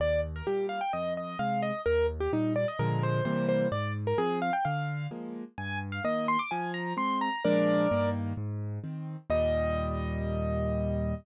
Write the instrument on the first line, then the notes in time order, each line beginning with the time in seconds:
acoustic grand piano
0.00 D#2 D5
0.36 A#4
0.47 A#2 G3 G4
0.69 F5
0.81 G5
0.93 F2 D#5
1.17 D#5
1.39 C3 G#3 F5
1.62 D#5
1.86 D#2 A#4
2.20 G4
2.33 A#2 G3 D#4
2.56 D5
2.68 D#5
2.79 A#2 D3 F3 G#3 A#4
3.03 C5
3.25 C3 E3 G3 A#3 C5
3.49 C5
3.72 G#2 D5
4.07 A#4
4.18 F3 C4 G#4
4.42 F5
4.53 G5
4.65 D3 F5
5.11 F3 G#3 A#3
5.58 G2 G#5
5.92 F5
6.04 D#3 A#3 D#5
6.28 C6
6.39 D6
6.51 F3 G#5
6.74 A#5
6.97 G#3 C4 C6
7.21 A#5
7.44 A#2 F3 G#3 D4 A#4 D5
7.91 G2 D#3 A#3
8.37 G#2
8.84 D#3 C4
9.30 D#2 A#2 G3 D#5